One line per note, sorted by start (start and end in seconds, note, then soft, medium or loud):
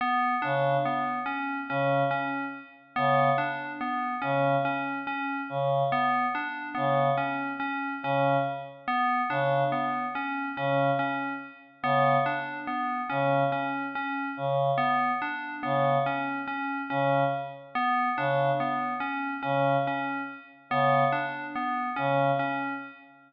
0.01 0.35 B3 medium
0.42 0.77 C#3 medium
0.42 0.76 D4 medium
0.85 1.19 B3 medium
1.26 1.60 C#4 medium
1.69 2.03 C#3 medium
1.69 2.04 C#4 medium
2.11 2.45 C#4 medium
2.96 3.30 C#3 medium
2.96 3.30 B3 medium
3.38 3.72 D4 medium
3.81 4.15 B3 medium
4.22 4.56 C#3 medium
4.22 4.55 C#4 medium
4.65 4.99 C#4 medium
5.07 5.41 C#4 medium
5.49 5.83 C#3 medium
5.92 6.26 B3 medium
6.35 6.69 D4 medium
6.75 7.10 C#3 medium
6.75 7.08 B3 medium
7.17 7.51 C#4 medium
7.60 7.93 C#4 medium
8.03 8.37 C#3 medium
8.03 8.38 C#4 medium
8.88 9.21 B3 medium
9.29 9.63 C#3 medium
9.29 9.64 D4 medium
9.72 10.06 B3 medium
10.15 10.49 C#4 medium
10.57 10.90 C#3 medium
10.57 10.91 C#4 medium
10.99 11.33 C#4 medium
11.83 12.17 C#3 medium
11.83 12.17 B3 medium
12.26 12.60 D4 medium
12.67 13.01 B3 medium
13.10 13.44 C#3 medium
13.10 13.43 C#4 medium
13.52 13.86 C#4 medium
13.95 14.29 C#4 medium
14.37 14.71 C#3 medium
14.78 15.11 B3 medium
15.22 15.55 D4 medium
15.63 15.98 C#3 medium
15.63 15.97 B3 medium
16.06 16.40 C#4 medium
16.48 16.81 C#4 medium
16.90 17.24 C#3 medium
16.90 17.24 C#4 medium
17.75 18.09 B3 medium
18.17 18.51 C#3 medium
18.17 18.52 D4 medium
18.60 18.94 B3 medium
19.00 19.34 C#4 medium
19.43 19.77 C#3 medium
19.43 19.76 C#4 medium
19.87 20.21 C#4 medium
20.70 21.04 C#3 medium
20.70 21.05 B3 medium
21.12 21.46 D4 medium
21.55 21.89 B3 medium
21.96 22.31 C#3 medium
21.96 22.30 C#4 medium
22.39 22.73 C#4 medium